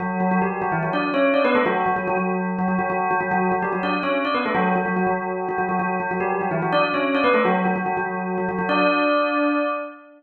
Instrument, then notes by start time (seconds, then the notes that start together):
tubular bells
0.00 F#3 F#4
0.20 F#3 F#4
0.31 F#3 F#4
0.42 G3 G4
0.62 F#3 F#4
0.72 E3 E4
0.83 F#3 F#4
0.93 D4 D5
1.14 C#4 C#5
1.34 D4 D5
1.45 B3 B4
1.55 A3 A4
1.66 F#3 F#4
1.86 F#3 F#4
1.96 F#3 F#4
2.07 F#3 F#4
2.17 F#3 F#4
2.59 F#3 F#4
2.68 F#3 F#4
2.79 F#3 F#4
2.90 F#3 F#4
3.11 F#3 F#4
3.21 F#3 F#4
3.31 F#3 F#4
3.52 F#3 F#4
3.62 G3 G4
3.73 F#3 F#4
3.83 D4 D5
4.03 C#4 C#5
4.25 D4 D5
4.34 B3 B4
4.46 A3 A4
4.55 F#3 F#4
4.76 F#3 F#4
4.86 F#3 F#4
4.96 F#3 F#4
5.07 F#3 F#4
5.49 F#3 F#4
5.58 F#3 F#4
5.69 F#3 F#4
5.79 F#3 F#4
6.00 F#3 F#4
6.11 F#3 F#4
6.20 G3 G4
6.41 F#3 F#4
6.51 E3 E4
6.62 F#3 F#4
6.72 D4 D5
6.94 C#4 C#5
7.15 D4 D5
7.24 B3 B4
7.34 A3 A4
7.45 F#3 F#4
7.65 F#3 F#4
7.76 F#3 F#4
7.86 F#3 F#4
7.97 F#3 F#4
8.38 F#3 F#4
8.49 F#3 F#4
8.59 F#3 F#4
8.69 D4 D5